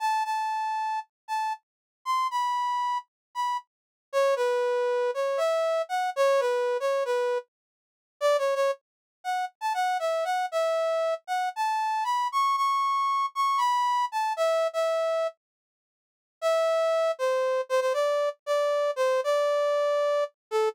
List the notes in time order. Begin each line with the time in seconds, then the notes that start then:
0.00 A5
0.25 A5
1.28 A5
2.05 C6
2.31 B5
3.35 B5
4.13 C#5
4.36 B4
5.14 C#5
5.37 E5
5.89 F#5
6.16 C#5
6.40 B4
6.80 C#5
7.05 B4
8.21 D5
8.38 C#5
8.55 C#5
9.24 F#5
9.61 A5
9.74 F#5
9.99 E5
10.24 F#5
10.52 E5
11.27 F#5
11.56 A5
12.04 B5
12.32 C#6
12.57 C#6
13.35 C#6
13.58 B5
14.12 A5
14.37 E5
14.73 E5
16.41 E5
17.19 C5
17.69 C5
17.81 C5
17.94 D5
18.46 D5
18.96 C5
19.24 D5
20.51 A4